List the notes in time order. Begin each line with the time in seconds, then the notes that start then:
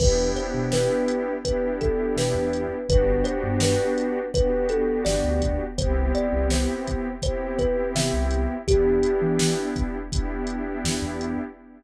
0.00 E2 B3 D4 E4 G4 B4, kick, crash
0.36 C5, closed hi-hat
0.54 B2
0.72 B4, snare
1.08 closed hi-hat
1.44 B3 D4 E4 G4 B4, kick, closed hi-hat
1.81 A4, kick, closed hi-hat
2.16 B2 B4, snare
2.34 E2
2.53 closed hi-hat
2.88 G1 B3 D4 F#4 G4 B4, kick, closed hi-hat
3.24 C5, closed hi-hat
3.43 G2
3.60 B4, snare
3.98 closed hi-hat
4.34 B3 D4 F#4 G4 B4, kick, closed hi-hat
4.69 A4, closed hi-hat
5.05 G1 D5, snare
5.24 D2
5.42 kick, closed hi-hat
5.78 C2 B3 C4 E4 G4 C5, kick, closed hi-hat
6.15 D5, closed hi-hat
6.33 C2
6.50 C5, snare
6.88 kick, closed hi-hat
7.22 B3 C4 E4 G4 C5, kick, closed hi-hat
7.59 B4, kick, closed hi-hat
7.95 C3 E5, snare
8.13 C2
8.31 closed hi-hat
8.67 E2 B3 D4 E4 G4, kick, closed hi-hat
9.03 closed hi-hat
9.22 E3
9.39 snare
9.76 kick, closed hi-hat
10.11 B3 D4 E4 G4, kick, closed hi-hat
10.47 closed hi-hat
10.84 E2, snare
11.02 E2
11.21 closed hi-hat